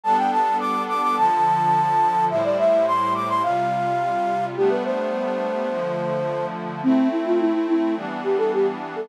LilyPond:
<<
  \new Staff \with { instrumentName = "Flute" } { \time 4/4 \key a \minor \tempo 4 = 106 a''16 g''16 a''8 d'''8 d'''16 d'''16 a''2 | e''16 d''16 e''8 c'''8 d'''16 c'''16 f''2 | g'16 b'16 c''2. r8 | c'8 e'16 f'16 e'16 e'16 e'8 r8 g'16 a'16 g'16 r8 a'16 | }
  \new Staff \with { instrumentName = "Pad 5 (bowed)" } { \time 4/4 \key a \minor <g b d' a'>2 <d f a'>2 | <a, g e' c''>2 <c g f'>2 | <g a b d'>2 <d f a>2 | <a c' e'>2 <e g b d'>2 | }
>>